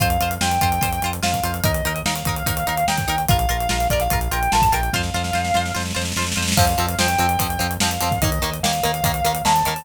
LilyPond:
<<
  \new Staff \with { instrumentName = "Distortion Guitar" } { \time 4/4 \key f \mixolydian \tempo 4 = 146 f''4 g''2 f''4 | ees''4 f''2 g''4 | f''4. d''16 f''8. g''16 g''16 a''16 a''16 g''8 | f''2 r2 |
f''4 g''2 f''4 | ees''4 f''2 a''4 | }
  \new Staff \with { instrumentName = "Acoustic Guitar (steel)" } { \time 4/4 \key f \mixolydian <f' c''>8 <f' c''>8 <f' c''>8 <f' c''>8 <f' c''>8 <f' c''>8 <f' c''>8 <f' c''>8 | <ees' bes'>8 <ees' bes'>8 <ees' bes'>8 <ees' bes'>8 <ees' bes'>8 <ees' bes'>8 <ees' bes'>8 <ees' bes'>8 | <f' bes'>8 <f' bes'>8 <f' bes'>8 <f' bes'>8 <f' bes'>8 <f' bes'>8 <f' bes'>8 <f' bes'>8 | <f' c''>8 <f' c''>8 <f' c''>8 <f' c''>8 <f' c''>8 <f' c''>8 <f' c''>8 <f' c''>8 |
<f c'>8 <f c'>8 <f c'>8 <f c'>8 <f c'>8 <f c'>8 <f c'>8 <f c'>8 | <ees bes>8 <ees bes>8 <ees bes>8 <ees bes>8 <ees bes>8 <ees bes>8 <ees bes>8 <ees bes>8 | }
  \new Staff \with { instrumentName = "Synth Bass 1" } { \clef bass \time 4/4 \key f \mixolydian f,8 f,8 f,8 f,8 f,8 f,8 f,8 f,8 | ees,8 ees,8 ees,8 ees,8 ees,8 ees,8 ees,8 ees,8 | bes,,8 bes,,8 bes,,8 bes,,8 bes,,8 bes,,8 bes,,8 bes,,8 | f,8 f,8 f,8 f,8 f,8 f,8 f,8 f,8 |
f,8 f,8 f,8 f,8 f,8 f,8 f,8 f,8 | ees,8 ees,8 ees,8 ees,8 ees,8 ees,8 ees,8 ees,8 | }
  \new DrumStaff \with { instrumentName = "Drums" } \drummode { \time 4/4 <hh bd>16 hh16 hh16 hh16 sn16 hh16 <hh bd>16 hh16 <hh bd>16 hh16 hh16 hh16 sn16 <hh bd>16 hh16 hh16 | <hh bd>16 hh16 hh16 hh16 sn16 hh16 <hh bd>16 hh16 <hh bd>16 hh16 hh16 hh16 sn16 <hh bd>16 hh16 hh16 | <hh bd>16 hh16 hh16 hh16 sn16 hh16 <hh bd>16 hh16 <hh bd>16 hh16 hh16 hh16 sn16 <hh bd>16 hh16 hh16 | <bd sn>16 sn16 sn16 sn16 sn16 sn16 sn16 sn16 sn32 sn32 sn32 sn32 sn32 sn32 sn32 sn32 sn32 sn32 sn32 sn32 sn32 sn32 sn32 sn32 |
<cymc bd>16 hh16 hh16 hh16 sn16 hh16 hh16 hh16 <hh bd>16 hh16 hh16 hh16 sn16 hh16 <hh sn>16 <hh bd>16 | <hh bd>16 hh16 hh16 hh16 sn16 hh16 hh16 hh16 <hh bd>16 hh16 hh16 hh16 sn16 hh16 <hh sn>16 hho16 | }
>>